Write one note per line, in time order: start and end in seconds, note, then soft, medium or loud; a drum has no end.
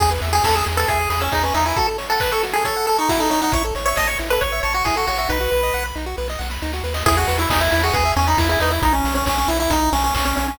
0.00 0.19 E2 medium
0.00 0.10 G#4 medium
0.00 kick medium
0.00 crash medium
0.11 0.21 B4 medium
0.21 0.40 E2 medium
0.21 0.32 E5 medium
0.21 open hi-hat medium
0.33 0.43 G#4 medium
0.33 0.44 G#5 medium
0.44 0.63 E2 medium
0.44 0.55 A4 medium
0.44 0.55 B5 medium
0.44 kick medium
0.44 snare medium
0.55 0.65 G#4 medium
0.55 0.65 E6 medium
0.66 0.85 E2 medium
0.66 0.76 G#4 medium
0.66 open hi-hat medium
0.77 0.88 A4 medium
0.77 0.87 B4 medium
0.88 1.07 E2 medium
0.88 1.09 G#4 medium
0.88 0.99 E5 medium
0.88 kick medium
0.88 closed hi-hat medium
0.99 1.09 G#5 medium
1.10 1.29 E2 medium
1.10 1.20 G#4 medium
1.10 1.20 B5 medium
1.10 open hi-hat medium
1.20 1.32 C#4 medium
1.20 1.30 E6 medium
1.32 1.52 E2 medium
1.32 1.43 D#4 medium
1.32 1.43 G#4 medium
1.32 kick medium
1.32 clap medium
1.43 1.54 C#4 medium
1.43 1.53 B4 medium
1.54 1.73 E2 medium
1.54 1.65 D#4 medium
1.54 1.64 E5 medium
1.54 open hi-hat medium
1.66 1.76 E4 medium
1.66 1.76 G#5 medium
1.76 1.87 F#4 medium
1.76 1.87 A4 medium
1.76 kick medium
1.76 closed hi-hat medium
1.87 1.97 A4 medium
1.98 2.08 C#5 medium
1.98 open hi-hat medium
2.10 2.20 A4 medium
2.10 2.20 F#5 medium
2.20 2.31 B4 medium
2.20 2.31 A5 medium
2.20 kick medium
2.20 clap medium
2.32 2.43 A4 medium
2.32 2.42 C#6 medium
2.43 2.53 F#4 medium
2.43 open hi-hat medium
2.53 2.64 G#4 medium
2.53 2.64 A4 medium
2.65 2.86 A4 medium
2.65 2.75 C#5 medium
2.65 kick medium
2.65 closed hi-hat medium
2.76 2.86 F#5 medium
2.86 2.97 A4 medium
2.86 2.97 A5 medium
2.86 open hi-hat soft
2.98 3.09 D#4 medium
2.98 3.08 C#6 medium
3.09 3.20 E4 medium
3.09 3.19 F#4 medium
3.09 kick medium
3.09 snare medium
3.19 3.30 D#4 medium
3.19 3.29 A4 medium
3.30 3.41 D#4 medium
3.30 3.40 C#5 medium
3.30 open hi-hat medium
3.42 3.52 D#4 medium
3.42 3.52 F#5 medium
3.52 3.72 A1 medium
3.52 3.63 E4 medium
3.52 3.64 C#5 medium
3.52 kick medium
3.52 closed hi-hat medium
3.64 3.74 A4 medium
3.75 3.94 A1 medium
3.75 3.85 C#5 medium
3.75 open hi-hat medium
3.86 3.96 C#5 medium
3.86 3.96 E5 medium
3.96 4.16 A1 soft
3.96 4.08 D#5 medium
3.96 4.07 A5 medium
3.96 kick medium
3.96 snare medium
4.07 4.18 C#5 medium
4.07 4.18 C#6 medium
4.18 4.38 A1 medium
4.18 4.29 E4 medium
4.18 open hi-hat medium
4.30 4.40 A4 medium
4.30 4.41 B4 medium
4.41 4.60 A1 medium
4.41 4.60 C#5 medium
4.41 4.52 C#5 medium
4.41 kick medium
4.41 closed hi-hat medium
4.52 4.62 E5 medium
4.63 4.82 A1 medium
4.63 4.73 C#5 medium
4.63 4.73 A5 medium
4.63 open hi-hat soft
4.73 4.85 F#4 medium
4.73 4.83 C#6 medium
4.84 5.04 A1 medium
4.84 4.96 E4 medium
4.84 4.95 G#4 medium
4.84 kick medium
4.84 clap medium
4.96 5.07 F#4 medium
4.96 5.06 A4 medium
5.07 5.27 A1 medium
5.07 5.18 F#4 medium
5.07 5.18 C#5 medium
5.07 open hi-hat medium
5.18 5.29 F#4 medium
5.18 5.28 E5 medium
5.29 5.48 B1 medium
5.29 5.39 D#4 medium
5.29 5.84 B4 medium
5.29 kick medium
5.29 snare medium
5.40 5.50 F#4 medium
5.51 5.71 B1 medium
5.51 5.61 B4 medium
5.51 snare soft
5.63 5.73 D#5 medium
5.73 5.93 B1 medium
5.73 5.84 F#5 medium
5.73 snare medium
5.85 5.95 B5 medium
5.95 6.14 B1 medium
5.95 6.05 D#4 medium
5.95 snare soft
6.06 6.16 F#4 medium
6.17 6.37 B1 medium
6.17 6.28 B4 medium
6.17 snare soft
6.28 6.39 D#5 medium
6.28 snare medium
6.39 6.58 B1 medium
6.39 6.49 F#5 medium
6.39 snare medium
6.50 6.61 B5 medium
6.50 snare medium
6.62 6.82 D2 medium
6.62 6.72 D#4 medium
6.62 snare medium
6.73 6.83 F#4 medium
6.73 snare medium
6.83 7.03 D#2 medium
6.83 6.94 B4 medium
6.83 snare medium
6.94 7.04 D#5 medium
6.94 snare medium
7.06 7.25 E2 medium
7.06 7.16 E4 medium
7.06 7.16 G#4 loud
7.06 kick medium
7.06 crash medium
7.17 7.37 F#4 medium
7.17 7.27 G#4 medium
7.28 7.47 E2 medium
7.28 7.38 B4 medium
7.28 open hi-hat medium
7.39 7.49 E4 medium
7.39 7.50 E5 medium
7.50 7.69 E2 medium
7.50 7.60 D#4 medium
7.50 7.60 G#5 medium
7.50 kick medium
7.50 snare loud
7.60 7.71 E4 medium
7.60 7.71 B5 medium
7.71 7.91 E2 medium
7.71 7.82 E4 medium
7.71 open hi-hat medium
7.83 7.94 F#4 medium
7.83 7.93 G#4 medium
7.93 8.12 E2 medium
7.93 8.12 G#4 medium
7.93 8.04 B4 medium
7.93 kick medium
7.93 closed hi-hat medium
8.05 8.15 E5 medium
8.16 8.35 E2 medium
8.16 8.27 C#4 medium
8.16 8.26 G#5 medium
8.16 open hi-hat medium
8.27 8.38 D#4 medium
8.27 8.37 B5 medium
8.38 8.56 E2 medium
8.38 8.48 E4 medium
8.38 kick medium
8.38 snare medium
8.49 8.60 E4 medium
8.49 8.59 G#4 medium
8.60 8.79 E2 medium
8.60 8.71 D#4 medium
8.60 8.71 B4 medium
8.60 open hi-hat medium
8.70 8.82 E4 medium
8.70 8.80 E5 medium
8.82 9.01 B1 medium
8.82 8.93 D#4 loud
8.82 kick medium
8.82 closed hi-hat medium
8.93 9.14 C#4 medium
9.04 9.23 B1 medium
9.04 open hi-hat medium
9.15 9.25 C#4 medium
9.26 9.45 B1 medium
9.26 9.37 C#4 medium
9.26 kick medium
9.26 clap medium
9.38 9.48 C#4 medium
9.48 9.67 B1 medium
9.48 9.59 E4 medium
9.48 open hi-hat medium
9.60 9.70 E4 medium
9.70 9.89 B1 medium
9.70 9.90 D#4 medium
9.70 kick medium
9.70 closed hi-hat medium
9.93 10.11 B1 medium
9.93 10.03 C#4 loud
9.93 open hi-hat medium
10.04 10.14 C#4 loud
10.15 10.34 B1 medium
10.15 10.25 C#4 medium
10.15 kick medium
10.15 clap loud
10.25 10.36 C#4 medium
10.37 10.56 B1 medium
10.37 10.47 C#4 medium
10.37 open hi-hat medium
10.48 10.58 C#4 medium